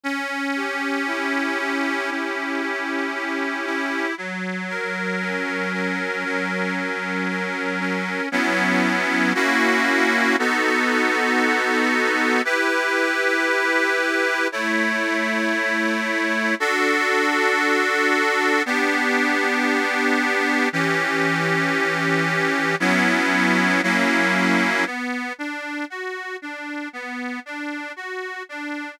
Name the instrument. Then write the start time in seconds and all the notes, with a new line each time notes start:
accordion
0.04 C#4
0.56 G4
1.07 E4
1.59 G4
2.11 C#4
2.62 G4
3.14 G4
3.66 E4
4.18 F#3
4.69 A#4
5.21 C#4
5.73 A#4
6.25 F#3
6.76 A#4
7.29 A#4
7.80 C#4
8.32 F#3 B3 C#4 E4
9.35 A#3 C#4 E4 F#4
10.39 B3 D#4 F#4 A4
12.45 E4 G4 B4
14.52 A3 E4 C#5
16.60 D4 F#4 A4
18.66 B3 D4 G4
20.73 E3 C#4 G4
22.80 F#3 B3 C#4 E4
23.83 F#3 A#3 C#4 E4
24.86 B3
25.39 D4
25.90 F#4
26.42 D4
26.93 B3
27.46 D4
27.96 F#4
28.49 D4